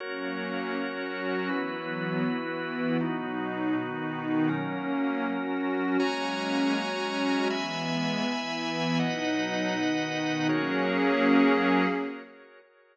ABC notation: X:1
M:6/8
L:1/8
Q:3/8=80
K:F#mix
V:1 name="Pad 2 (warm)"
[F,A,C]3 [F,CF]3 | [E,F,B,]3 [E,B,E]3 | [B,,F,D]3 [B,,D,D]3 | [F,A,C]3 [F,CF]3 |
[F,G,A,C]3 [F,G,CF]3 | [E,G,B,]3 [E,B,E]3 | [B,,F,D]3 [B,,D,D]3 | [F,A,CG]6 |]
V:2 name="Drawbar Organ"
[FAc]6 | [EFB]6 | [B,DF]6 | [F,CA]6 |
[Fcga]6 | [egb]6 | [Bdf]6 | [FGAc]6 |]